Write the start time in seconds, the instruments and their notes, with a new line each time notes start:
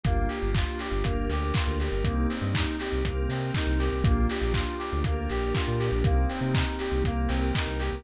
0.04 synth bass 2 G1, pad 5 (bowed) A#3 D4 F4 G4, electric piano 2 A#3, kick, closed hi-hat
0.28 electric piano 2 G4, open hi-hat
0.42 synth bass 2 G1
0.55 electric piano 2 F4, kick, clap
0.79 electric piano 2 G4, open hi-hat
0.92 synth bass 2 G1
1.03 synth bass 2 G1, electric piano 2 A#3, pad 5 (bowed) A#3 D4 G4 A#4, kick, closed hi-hat
1.29 synth bass 2 D2, electric piano 2 G4, open hi-hat
1.54 electric piano 2 F4, kick, clap
1.67 synth bass 2 D2
1.80 electric piano 2 G4, open hi-hat
1.92 synth bass 2 G1
2.04 synth bass 2 C2, electric piano 2 A#3, pad 5 (bowed) A#3 C4 D#4 G4, kick, closed hi-hat
2.29 electric piano 2 C4, open hi-hat
2.42 synth bass 2 G2
2.54 electric piano 2 D#4, kick, clap
2.79 electric piano 2 G4, open hi-hat
2.92 synth bass 2 C2
3.04 synth bass 2 C2, pad 5 (bowed) A#3 C4 G4 A#4, electric piano 2 A#3, kick, closed hi-hat
3.29 synth bass 2 C3, electric piano 2 C4, open hi-hat
3.54 electric piano 2 D#4, kick, clap
3.67 synth bass 2 C2
3.80 electric piano 2 G4, open hi-hat
3.92 synth bass 2 C2
4.04 synth bass 2 A#1, pad 5 (bowed) A#3 D4 F4 G4, electric piano 2 A#3, kick, closed hi-hat
4.29 electric piano 2 G4, open hi-hat
4.42 synth bass 2 A#1
4.54 electric piano 2 F4, kick, clap
4.79 electric piano 2 G4, open hi-hat
4.92 synth bass 2 D2
5.04 synth bass 2 D2, pad 5 (bowed) A#3 D4 G4 A#4, electric piano 2 A#3, kick, closed hi-hat
5.29 synth bass 2 A#1, electric piano 2 G4, open hi-hat
5.54 electric piano 2 F4, kick, clap
5.68 synth bass 2 A#2
5.79 electric piano 2 G4, open hi-hat
5.92 synth bass 2 A#1
6.04 synth bass 2 C2, pad 5 (bowed) A#3 C4 D#4 G4, electric piano 2 A#3, kick, closed hi-hat
6.29 electric piano 2 C4, open hi-hat
6.41 synth bass 2 C3
6.53 electric piano 2 D#4, kick, clap
6.79 electric piano 2 G4, open hi-hat
6.92 synth bass 2 C2
7.04 synth bass 2 C2, pad 5 (bowed) A#3 C4 G4 A#4, electric piano 2 A#3, kick, closed hi-hat
7.28 synth bass 2 C2, electric piano 2 C4, open hi-hat
7.55 electric piano 2 D#4, kick, clap
7.67 synth bass 2 C2
7.79 electric piano 2 G4, open hi-hat
7.92 synth bass 2 C2